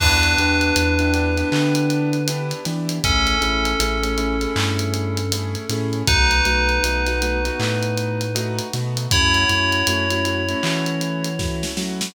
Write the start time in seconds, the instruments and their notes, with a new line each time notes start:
0.00 synth bass 2 E2, acoustic grand piano B3 D4 E4 G4, tubular bells D4 B4, kick, crash
0.23 closed hi-hat
0.38 synth bass 2 E2, acoustic grand piano B3 D4 E4 G4, closed hi-hat
0.61 closed hi-hat
0.76 synth bass 2 E2, acoustic grand piano B3 D4 E4 G4, closed hi-hat
0.99 acoustic grand piano B3 D4 E4 G4, closed hi-hat
1.14 acoustic grand piano B3 D4 E4 G4, closed hi-hat
1.37 acoustic grand piano B3 D4 E4 G4, closed hi-hat
1.52 synth bass 2 D3, acoustic grand piano B3 D4 E4 G4, clap
1.75 closed hi-hat
1.90 closed hi-hat
2.13 closed hi-hat
2.28 acoustic grand piano B3 D4 E4 G4, closed hi-hat
2.51 closed hi-hat
2.65 synth bass 2 E3, acoustic grand piano B3 D4 E4 G4, snare, closed hi-hat
2.89 closed hi-hat
3.04 synth bass 2 A1, acoustic grand piano A3 C#4 E4 G#4, tubular bells C#4 A4, kick, closed hi-hat
3.27 closed hi-hat
3.41 synth bass 2 A1, acoustic grand piano A3 C#4 E4 G#4, closed hi-hat
3.65 closed hi-hat
3.80 synth bass 2 A1, acoustic grand piano A3 C#4 E4 G#4, closed hi-hat
4.03 acoustic grand piano A3 C#4 E4 G#4, closed hi-hat
4.18 acoustic grand piano A3 C#4 E4 G#4, closed hi-hat
4.41 acoustic grand piano A3 C#4 E4 G#4, closed hi-hat
4.56 synth bass 2 G2, acoustic grand piano A3 C#4 E4 G#4, clap
4.79 closed hi-hat
4.94 closed hi-hat
5.17 closed hi-hat
5.32 acoustic grand piano A3 C#4 E4 G#4, closed hi-hat
5.55 closed hi-hat
5.69 synth bass 2 A2, acoustic grand piano A3 C#4 E4 G#4, snare, closed hi-hat
5.93 closed hi-hat
6.07 synth bass 2 B1, acoustic grand piano A3 B3 D#4 F#4, tubular bells D#4 B4, kick, closed hi-hat
6.31 closed hi-hat
6.45 synth bass 2 B1, acoustic grand piano A3 B3 D#4 F#4, closed hi-hat
6.69 closed hi-hat
6.83 synth bass 2 B1, acoustic grand piano A3 B3 D#4 F#4, closed hi-hat
7.06 acoustic grand piano A3 B3 D#4 F#4, snare, closed hi-hat
7.21 acoustic grand piano A3 B3 D#4 F#4, closed hi-hat
7.45 acoustic grand piano A3 B3 D#4 F#4, closed hi-hat
7.59 synth bass 2 A2, acoustic grand piano A3 B3 D#4 F#4, clap
7.83 closed hi-hat
7.97 closed hi-hat
8.21 closed hi-hat
8.35 acoustic grand piano A3 B3 D#4 F#4, closed hi-hat
8.59 closed hi-hat
8.73 synth bass 2 B2, acoustic grand piano A3 B3 D#4 F#4, snare, closed hi-hat
8.97 closed hi-hat
9.11 synth bass 2 F#2, acoustic grand piano A3 C#4 E4 F#4, tubular bells E4 C#5, kick, closed hi-hat
9.34 closed hi-hat
9.49 synth bass 2 F#2, acoustic grand piano A3 C#4 E4 F#4, snare, closed hi-hat
9.72 closed hi-hat
9.87 synth bass 2 F#2, acoustic grand piano A3 C#4 E4 F#4, closed hi-hat
10.10 acoustic grand piano A3 C#4 E4 F#4, closed hi-hat
10.25 acoustic grand piano A3 C#4 E4 F#4, closed hi-hat
10.49 acoustic grand piano A3 C#4 E4 F#4, closed hi-hat
10.63 synth bass 2 E3, acoustic grand piano A3 C#4 E4 F#4, clap
10.86 closed hi-hat
11.01 closed hi-hat
11.25 closed hi-hat
11.39 acoustic grand piano A3 C#4 E4 F#4, kick, snare
11.63 snare
11.77 synth bass 2 F#3, acoustic grand piano A3 C#4 E4 F#4, snare
12.01 snare